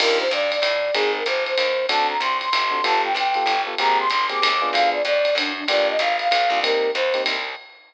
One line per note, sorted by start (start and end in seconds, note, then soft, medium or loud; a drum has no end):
0.00 0.28 D#2 medium
0.00 0.24 D4 medium
0.00 0.24 D#4 medium
0.00 0.24 F4 medium
0.00 0.24 G4 medium
0.00 0.18 A#4 loud
0.00 crash loud
0.00 ride loud
0.20 0.31 C5 medium
0.31 0.60 G2 medium
0.31 0.51 D5 medium
0.31 hi-hat pedal medium
0.31 ride medium
0.52 0.94 D5 medium
0.52 ride medium
0.62 0.91 A2 medium
0.62 kick medium
0.62 ride loud
0.94 1.24 G#1 medium
0.94 1.19 C4 medium
0.94 1.19 D#4 medium
0.94 1.12 G#4 medium
0.94 1.19 G#4 medium
0.94 1.19 A#4 medium
0.94 ride loud
1.15 1.27 A#4 medium
1.26 1.55 G1 medium
1.26 1.44 C5 medium
1.26 kick medium
1.26 hi-hat pedal medium
1.26 ride medium
1.46 1.86 C5 medium
1.46 ride medium
1.57 1.87 D#2 medium
1.57 ride loud
1.89 2.18 D2 medium
1.89 2.14 C4 medium
1.89 2.14 D4 medium
1.89 2.14 F#4 medium
1.89 2.14 A4 medium
1.89 2.07 A5 medium
1.89 ride loud
2.09 2.20 A#5 medium
2.20 2.49 C2 medium
2.20 2.37 C6 medium
2.20 hi-hat pedal medium
2.20 ride medium
2.41 2.83 C6 medium
2.41 ride medium
2.53 2.82 G1 medium
2.53 ride loud
2.71 2.79 C4 medium
2.71 2.79 D4 medium
2.71 2.79 F#4 medium
2.71 2.79 A4 medium
2.84 3.14 G1 loud
2.84 3.08 B3 medium
2.84 3.08 F4 medium
2.84 3.08 G4 medium
2.84 3.08 A4 medium
2.84 3.02 A5 medium
2.84 ride loud
3.03 3.14 G5 medium
3.14 3.44 B1 medium
3.14 3.62 G5 medium
3.14 hi-hat pedal medium
3.14 ride medium
3.34 3.55 B3 medium
3.34 3.55 F4 medium
3.34 3.55 G4 medium
3.34 3.55 A4 medium
3.34 ride medium
3.46 3.75 G1 medium
3.46 ride medium
3.67 3.75 B3 medium
3.67 3.75 F4 medium
3.67 3.75 G4 medium
3.67 3.75 A4 medium
3.78 4.08 G#1 medium
3.78 4.04 A#3 medium
3.78 4.04 C4 medium
3.78 4.04 G4 medium
3.78 4.04 G#4 medium
3.78 3.98 A#5 loud
3.78 ride loud
4.00 4.09 C6 medium
4.10 4.40 G1 medium
4.10 4.26 C6 medium
4.10 kick medium
4.10 hi-hat pedal medium
4.10 ride medium
4.29 4.49 A#3 medium
4.29 4.49 C4 medium
4.29 4.49 G4 medium
4.29 4.49 G#4 medium
4.29 4.69 D6 medium
4.29 ride medium
4.42 4.71 D#2 medium
4.42 ride loud
4.62 4.98 B3 medium
4.62 4.98 D4 medium
4.62 4.98 F4 medium
4.62 4.98 G#4 medium
4.73 5.02 D2 medium
4.73 4.90 F5 loud
4.73 ride loud
4.93 5.03 D5 medium
5.05 5.34 F2 medium
5.05 5.35 D5 loud
5.05 hi-hat pedal medium
5.05 ride medium
5.25 ride medium
5.35 5.64 F#2 medium
5.35 5.53 D4 medium
5.35 kick medium
5.35 ride loud
5.56 5.67 D4 medium
5.68 5.97 G1 medium
5.68 5.93 A#3 medium
5.68 5.93 D4 medium
5.68 5.93 F4 medium
5.68 5.93 G4 medium
5.68 5.87 D5 medium
5.68 ride loud
5.89 6.00 D#5 medium
5.99 6.29 G#1 medium
5.99 6.16 F5 medium
5.99 kick medium
5.99 hi-hat pedal medium
5.99 ride medium
6.19 6.60 F5 medium
6.19 ride medium
6.31 6.50 B1 medium
6.31 kick medium
6.31 ride loud
6.50 6.91 C2 medium
6.50 6.59 A#3 medium
6.50 6.59 D4 medium
6.50 6.59 F4 medium
6.50 6.59 G4 medium
6.63 6.88 A#3 medium
6.63 6.88 C4 medium
6.63 6.88 D#4 medium
6.63 6.88 G4 medium
6.63 6.91 A#4 loud
6.63 ride loud
6.94 7.24 D#2 medium
6.94 7.22 C5 medium
6.94 hi-hat pedal medium
6.94 ride medium
7.14 7.34 A#3 medium
7.14 7.34 C4 medium
7.14 7.34 D#4 medium
7.14 7.34 G4 medium
7.14 ride medium
7.26 7.55 C2 medium
7.26 ride loud